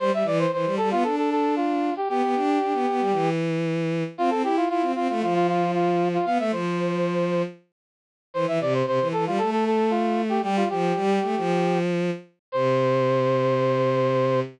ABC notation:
X:1
M:4/4
L:1/16
Q:1/4=115
K:C
V:1 name="Brass Section"
c e d c c2 A F A A A2 F3 G | G10 z6 | F A G F F2 F F F F F2 F3 F | f e c8 z6 |
c e d c c2 A F A A A2 F3 G | G F G10 z4 | c16 |]
V:2 name="Violin"
G, G, E,2 E, G, G, B, D8 | B, B, D2 D B, B, G, E,8 | C C E2 E C C A, F,8 | B, A, F,8 z6 |
E, E, C,2 C, E, E, G, A,8 | G,2 F,2 G,2 A, F,7 z2 | C,16 |]